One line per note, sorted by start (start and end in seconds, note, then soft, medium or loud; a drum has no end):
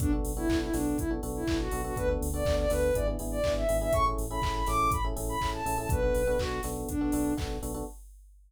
0.00 0.21 B1 medium
0.00 0.10 B3 medium
0.00 0.12 D4 loud
0.00 0.10 D4 medium
0.00 0.10 F#4 medium
0.00 0.10 A4 medium
0.00 kick loud
0.00 closed hi-hat loud
0.12 0.32 B3 medium
0.12 0.32 D4 medium
0.12 0.32 F#4 medium
0.12 0.32 A4 medium
0.25 0.46 B1 medium
0.25 open hi-hat medium
0.37 0.47 B3 medium
0.37 0.47 D4 medium
0.37 0.57 E4 loud
0.37 0.47 F#4 medium
0.37 0.47 A4 medium
0.49 0.70 B1 medium
0.49 0.69 B3 medium
0.49 0.69 D4 medium
0.49 0.69 F#4 medium
0.49 0.69 A4 medium
0.49 kick medium
0.49 clap loud
0.62 0.73 E4 medium
0.74 0.95 B1 medium
0.74 1.03 B3 medium
0.74 0.97 D4 medium
0.74 1.03 D4 medium
0.74 1.03 F#4 medium
0.74 1.03 A4 medium
0.74 snare medium
0.74 open hi-hat medium
0.98 1.19 B1 medium
0.98 1.10 E4 medium
0.98 kick medium
0.98 closed hi-hat medium
1.11 1.20 B3 medium
1.11 1.20 D4 medium
1.11 1.20 F#4 medium
1.11 1.20 A4 medium
1.23 1.44 B1 medium
1.23 1.43 B3 medium
1.23 1.43 D4 medium
1.23 1.43 F#4 medium
1.23 1.43 A4 medium
1.23 open hi-hat medium
1.36 1.57 E4 medium
1.47 1.69 B1 medium
1.47 1.67 B3 medium
1.47 1.67 D4 medium
1.47 1.67 F#4 medium
1.47 1.67 A4 medium
1.47 kick medium
1.47 clap loud
1.60 1.81 F#4 loud
1.71 1.93 B1 medium
1.71 1.82 B3 medium
1.71 1.82 D4 medium
1.71 1.82 F#4 medium
1.71 1.82 A4 medium
1.71 open hi-hat medium
1.84 1.94 B3 medium
1.84 1.94 D4 medium
1.84 1.94 F#4 medium
1.84 1.97 F#4 medium
1.84 1.94 A4 medium
1.96 2.18 D2 medium
1.96 2.07 B3 medium
1.96 2.07 D4 medium
1.96 2.07 F#4 medium
1.96 2.07 A4 medium
1.96 2.09 B4 loud
1.96 kick medium
1.96 closed hi-hat medium
2.09 2.28 B3 medium
2.09 2.28 D4 medium
2.09 2.28 F#4 medium
2.09 2.28 A4 medium
2.21 2.42 D2 medium
2.21 open hi-hat medium
2.34 2.43 B3 medium
2.34 2.43 D4 medium
2.34 2.43 F#4 medium
2.34 2.43 A4 medium
2.34 2.56 D5 medium
2.45 2.67 D2 medium
2.45 2.66 B3 medium
2.45 2.66 D4 medium
2.45 2.66 F#4 medium
2.45 2.66 A4 medium
2.45 kick medium
2.45 clap loud
2.59 2.71 D5 loud
2.70 2.91 D2 medium
2.70 2.90 B3 medium
2.70 2.90 D4 medium
2.70 2.90 F#4 medium
2.70 2.90 A4 medium
2.70 2.94 B4 loud
2.70 snare medium
2.70 open hi-hat medium
2.94 3.16 G#1 medium
2.94 3.05 B3 medium
2.94 3.05 D4 medium
2.94 3.05 E4 medium
2.94 3.05 G#4 medium
2.94 3.07 D5 medium
2.94 kick medium
2.94 closed hi-hat medium
3.07 3.17 B3 medium
3.07 3.17 D4 medium
3.07 3.17 E4 medium
3.07 3.17 G#4 medium
3.19 3.41 G#1 medium
3.19 3.39 B3 medium
3.19 3.39 D4 medium
3.19 3.39 E4 medium
3.19 3.39 G#4 medium
3.19 open hi-hat medium
3.31 3.53 D5 loud
3.44 3.65 G#1 medium
3.44 3.64 B3 medium
3.44 3.64 D4 medium
3.44 3.64 E4 medium
3.44 3.64 G#4 medium
3.44 kick medium
3.44 clap loud
3.57 3.77 E5 medium
3.69 3.90 G#1 medium
3.69 3.79 B3 medium
3.69 3.79 D4 medium
3.69 3.79 E4 medium
3.69 3.79 G#4 medium
3.69 open hi-hat medium
3.81 3.91 B3 medium
3.81 3.91 D4 medium
3.81 3.91 E4 medium
3.81 3.91 G#4 medium
3.81 3.93 E5 loud
3.93 4.14 A1 medium
3.93 4.03 C#4 medium
3.93 4.03 E4 medium
3.93 4.03 G#4 medium
3.93 4.03 A4 medium
3.93 4.05 C#6 loud
3.93 kick medium
3.93 closed hi-hat medium
4.06 4.25 C#4 medium
4.06 4.25 E4 medium
4.06 4.25 G#4 medium
4.06 4.25 A4 medium
4.18 4.39 A1 medium
4.18 open hi-hat medium
4.30 4.40 C#4 medium
4.30 4.40 E4 medium
4.30 4.40 G#4 medium
4.30 4.40 A4 medium
4.30 4.54 B5 medium
4.42 4.63 A1 medium
4.42 4.62 C#4 medium
4.42 4.62 E4 medium
4.42 4.62 G#4 medium
4.42 4.62 A4 medium
4.42 kick medium
4.42 clap loud
4.55 4.67 B5 medium
4.66 4.88 A1 medium
4.66 4.97 C#4 medium
4.66 4.97 E4 medium
4.66 4.97 G#4 medium
4.66 4.97 A4 medium
4.66 4.90 D6 loud
4.66 snare medium
4.66 open hi-hat medium
4.91 5.13 A1 medium
4.91 5.04 B5 medium
4.91 kick medium
4.91 closed hi-hat loud
5.04 5.14 C#4 medium
5.04 5.14 E4 medium
5.04 5.14 G#4 medium
5.04 5.14 A4 medium
5.16 5.37 A1 medium
5.16 5.36 C#4 medium
5.16 5.36 E4 medium
5.16 5.36 G#4 medium
5.16 5.36 A4 medium
5.16 open hi-hat medium
5.29 5.49 B5 loud
5.41 5.62 A1 medium
5.41 5.61 C#4 medium
5.41 5.61 E4 medium
5.41 5.61 G#4 medium
5.41 5.61 A4 medium
5.41 kick medium
5.41 clap medium
5.54 5.77 A5 loud
5.66 5.87 A1 medium
5.66 5.76 C#4 medium
5.66 5.76 E4 medium
5.66 5.76 G#4 medium
5.66 5.76 A4 medium
5.66 open hi-hat medium
5.78 5.88 C#4 medium
5.78 5.88 E4 medium
5.78 5.88 G#4 medium
5.78 5.88 A4 medium
5.78 5.90 A5 medium
5.89 6.11 B1 loud
5.89 6.00 B3 medium
5.89 6.00 D4 medium
5.89 6.00 F#4 medium
5.89 6.00 A4 medium
5.89 6.38 B4 medium
5.89 kick loud
5.89 closed hi-hat loud
6.03 6.22 B3 medium
6.03 6.22 D4 medium
6.03 6.22 F#4 medium
6.03 6.22 A4 medium
6.15 6.36 B1 medium
6.15 open hi-hat medium
6.27 6.37 B3 medium
6.27 6.37 D4 medium
6.27 6.37 F#4 medium
6.27 6.37 A4 medium
6.39 6.60 B1 medium
6.39 6.59 B3 medium
6.39 6.59 D4 medium
6.39 6.61 F#4 loud
6.39 6.59 F#4 medium
6.39 6.59 A4 medium
6.39 kick medium
6.39 clap loud
6.63 6.85 B1 medium
6.63 6.93 B3 medium
6.63 6.93 D4 medium
6.63 6.93 F#4 medium
6.63 6.93 A4 medium
6.63 snare medium
6.63 open hi-hat medium
6.89 7.10 B1 medium
6.89 7.34 D4 medium
6.89 kick medium
6.89 closed hi-hat medium
7.01 7.11 B3 medium
7.01 7.11 D4 medium
7.01 7.11 F#4 medium
7.01 7.11 A4 medium
7.12 7.34 B1 medium
7.12 7.33 B3 medium
7.12 7.33 D4 medium
7.12 7.33 F#4 medium
7.12 7.33 A4 medium
7.12 open hi-hat medium
7.37 7.59 B1 medium
7.37 7.57 B3 medium
7.37 7.57 D4 medium
7.37 7.57 F#4 medium
7.37 7.57 A4 medium
7.37 kick medium
7.37 clap medium
7.62 7.83 B1 medium
7.62 7.72 B3 medium
7.62 7.72 D4 medium
7.62 7.72 F#4 medium
7.62 7.72 A4 medium
7.62 open hi-hat medium
7.74 7.84 B3 medium
7.74 7.84 D4 medium
7.74 7.84 F#4 medium
7.74 7.84 A4 medium